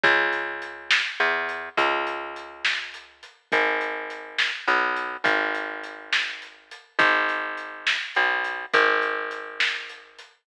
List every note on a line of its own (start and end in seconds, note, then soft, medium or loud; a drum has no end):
0.04 1.02 C#2 loud
0.04 kick loud
0.04 closed hi-hat loud
0.33 closed hi-hat medium
0.62 closed hi-hat medium
0.91 snare loud
1.20 1.69 E2 medium
1.20 closed hi-hat medium
1.49 closed hi-hat medium
1.77 3.25 C#2 medium
1.77 kick medium
1.77 closed hi-hat loud
2.07 closed hi-hat medium
2.36 closed hi-hat medium
2.65 snare loud
2.94 closed hi-hat medium
3.23 closed hi-hat medium
3.52 4.51 G#1 medium
3.52 kick loud
3.52 closed hi-hat loud
3.81 closed hi-hat medium
4.10 closed hi-hat medium
4.39 snare loud
4.68 5.17 B1 medium
4.68 closed hi-hat medium
4.96 closed hi-hat medium
5.24 6.72 G#1 medium
5.24 kick loud
5.24 closed hi-hat loud
5.55 closed hi-hat medium
5.84 closed hi-hat medium
6.13 snare loud
6.42 closed hi-hat medium
6.71 closed hi-hat loud
6.99 7.97 G#1 loud
6.99 kick loud
6.99 closed hi-hat loud
7.29 closed hi-hat medium
7.57 closed hi-hat medium
7.87 snare loud
8.15 8.66 B1 medium
8.15 closed hi-hat medium
8.44 closed hi-hat medium
8.74 10.21 G#1 medium
8.74 kick medium
8.74 closed hi-hat loud
9.02 closed hi-hat medium
9.31 closed hi-hat medium
9.60 snare loud
9.89 closed hi-hat medium
10.19 closed hi-hat medium